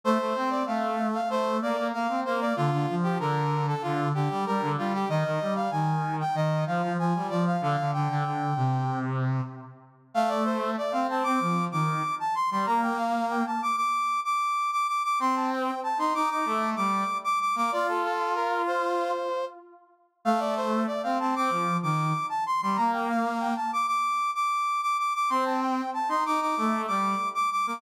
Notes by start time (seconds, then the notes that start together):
0.04 A3 C5
0.18 A3
0.35 C4
0.50 D5
0.66 A3 F5
1.14 F5
1.29 A3 C5
1.62 A#3 D5
1.78 A#3
1.92 A#3 F5
2.09 C4
2.25 A#3 C5
2.41 D5
2.56 D3 F4
2.71 D3
2.89 F3
3.03 G4
3.19 D3 A#4
3.68 A4
3.82 D3 F4
4.14 D3 G4
4.30 G3
4.46 G3 A#4
4.61 D3
4.77 G3 F4
4.94 G4
5.09 D#3 D#5
5.24 D#3
5.41 G3
5.56 F5
5.71 D#3 G#5
6.21 G5
6.34 D#3 D#5
6.67 F3 F5
6.82 F3
6.98 F3 G#5
7.15 G3
7.29 F3 D5
7.47 F5
7.61 D3 F5
7.78 D3
7.93 D3 G5
8.09 D3
8.24 D3
8.56 C3
10.14 A3 F5
10.29 D5
10.44 C5
10.78 D5
10.92 C4 F5
11.08 C4 A5
11.23 C4 D6
11.40 F3
11.72 D#3 D6
12.20 A5
12.35 C6
12.51 G3 C6
12.66 A#3 A#5
12.83 G5
12.98 F5
13.30 G5
13.46 A5
13.62 D6
13.76 D6
14.25 D6
14.72 D6
14.88 D6
15.04 D6
15.20 C4 C6
15.36 A5
15.51 G5
15.83 A5
15.98 D#4 C6
16.14 D#4 D6
16.30 D#4 D6
16.45 A3
16.76 G3 D6
17.24 D6
17.40 D6
17.55 A#3 D6
17.72 F4 D5
17.89 A4
18.04 A4
18.35 A#4
18.67 C5
20.25 A3 F5
20.40 D5
20.56 C5
20.87 D5
21.03 C4 F5
21.20 C4 A5
21.35 C4 D6
21.50 F3
21.83 D#3 D6
22.29 A5
22.46 C6
22.61 G3 C6
22.76 A#3 A#5
22.93 G5
23.09 F5
23.40 G5
23.56 A5
23.73 D6
23.87 D6
24.35 D6
24.82 D6
24.98 D6
25.15 D6
25.30 C4 C6
25.45 A5
25.61 G5
25.94 A5
26.09 D#4 C6
26.25 D#4 D6
26.40 D#4 D6
26.57 A3
26.87 G3 D6
27.35 D6
27.52 D6
27.67 A#3 D6